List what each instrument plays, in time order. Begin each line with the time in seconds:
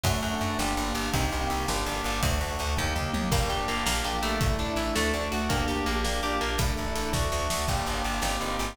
0.03 electric bass (finger) F#2, drawbar organ A3 D4 F#4, electric piano 1 A3 D4 F#4, kick, ride
0.13 electric piano 1 A3 D4 F#4
0.22 electric bass (finger) F#2, ride
0.33 electric piano 1 A3 D4 F#4
0.41 electric bass (finger) F#2, ride
0.58 electric bass (finger) G1, electric piano 1 A#3 D4 G4, drawbar organ A#3 D4 G4, snare
0.77 electric bass (finger) G1, electric piano 1 A#3 D4 G4, ride
0.94 electric bass (finger) G1, ride
1.13 electric bass (finger) C2, drawbar organ A#3 C4 D#4 G4, electric piano 1 A#3 C4 D#4 G4, kick, ride
1.23 electric piano 1 A#3 C4 D#4 G4
1.32 electric bass (finger) C2, ride
1.41 electric piano 1 A#3 C4 D#4 G4
1.50 electric bass (finger) C2, ride
1.68 electric bass (finger) G1, drawbar organ A#3 D4 G4, electric piano 1 A#3 D4 G4, snare
1.86 electric bass (finger) G1, electric piano 1 A#3 D4 G4, ride
2.04 electric bass (finger) G1, ride
2.23 electric bass (finger) D2, electric piano 1 A3 D4 F#4, drawbar organ A3 D4 F#4, kick, ride
2.31 electric piano 1 A3 D4 F#4
2.41 electric bass (finger) D2, ride
2.52 electric piano 1 A3 D4 F#4
2.59 electric bass (finger) D2, ride
2.77 electric bass (finger) D#2, electric piano 1 A#3 D#4 G4, drawbar organ A#3 D#4 G4, kick, floor tom
2.95 electric bass (finger) D#2, electric piano 1 A#3 D#4 G4, mid tom
3.13 electric bass (finger) D#2, high tom
3.31 electric bass (finger) G1, acoustic guitar (steel) A#3, drawbar organ A#3 D4 G4, electric piano 1 A#3 D4 G4, kick, crash
3.41 electric piano 1 A#3 D4 G4
3.50 electric bass (finger) G1, acoustic guitar (steel) G4, closed hi-hat
3.59 electric piano 1 A#3 D4 G4
3.68 electric bass (finger) G1, acoustic guitar (steel) A#3, closed hi-hat
3.86 electric bass (finger) A#1, acoustic guitar (steel) A#3, drawbar organ A#3 D4 G4, electric piano 1 A#3 D4 G4, snare
4.04 electric bass (finger) A#1, electric piano 1 A#3 D4 G4, acoustic guitar (steel) G4, closed hi-hat
4.22 electric bass (finger) A#1, acoustic guitar (steel) A3, closed hi-hat
4.41 electric bass (finger) A1, electric piano 1 A3 D4 E4, drawbar organ A3 D4 E4, kick, closed hi-hat
4.50 electric piano 1 A3 D4 E4
4.59 electric bass (finger) A1, acoustic guitar (steel) D4, closed hi-hat
4.69 electric piano 1 A3 D4 E4
4.76 electric bass (finger) A1, acoustic guitar (steel) E4, closed hi-hat
4.95 electric bass (finger) D2, electric piano 1 A3 D4 F#4, acoustic guitar (steel) A3, drawbar organ A3 D4 F#4, snare
5.14 electric bass (finger) D2, electric piano 1 A3 D4 F#4, acoustic guitar (steel) D4, closed hi-hat
5.32 electric bass (finger) D2, acoustic guitar (steel) F#4, closed hi-hat
5.49 electric bass (finger) D2, acoustic guitar (steel) A#3, electric piano 1 A#3 D4 G4, drawbar organ A#3 D4 G4, kick, closed hi-hat
5.59 electric piano 1 A#3 D4 G4
5.68 electric bass (finger) D2, acoustic guitar (steel) G4, closed hi-hat
5.77 electric piano 1 A#3 D4 G4
5.86 electric bass (finger) A#1, acoustic guitar (steel) A#3, closed hi-hat
6.04 acoustic guitar (steel) A#3, electric piano 1 A#3 D4 G4, drawbar organ A#3 D4 G4, snare
6.23 electric bass (finger) A#1, electric piano 1 A#3 D4 G4, acoustic guitar (steel) G4, closed hi-hat
6.41 electric bass (finger) A#1, acoustic guitar (steel) A#3, closed hi-hat
6.58 electric bass (finger) A1, drawbar organ A3 D4 E4, electric piano 1 A3 D4 E4, kick, closed hi-hat
6.69 electric piano 1 A3 D4 E4
6.77 electric bass (finger) A1, closed hi-hat
6.86 electric piano 1 A3 D4 E4
6.95 electric bass (finger) A1, closed hi-hat
7.13 electric bass (finger) D2, electric piano 1 A3 D4 F#4, drawbar organ A3 D4 F#4, kick, snare
7.32 electric bass (finger) D2, electric piano 1 A3 D4 F#4, snare
7.50 electric bass (finger) D2, snare
7.68 electric bass (finger) G1, electric piano 1 A#3 D4 G4, drawbar organ A#3 D4 G4, kick, crash
7.76 electric piano 1 A#3 D4 G4
7.86 electric bass (finger) G1, ride
7.94 electric piano 1 A#3 D4 G4
8.04 electric bass (finger) G1, ride
8.22 electric bass (finger) G1, electric piano 1 A#3 C4 D#4 G4, drawbar organ A#3 C4 D#4 G4, snare
8.41 electric bass (finger) G1, electric piano 1 A#3 C4 D#4 G4, ride
8.59 electric bass (finger) G1, ride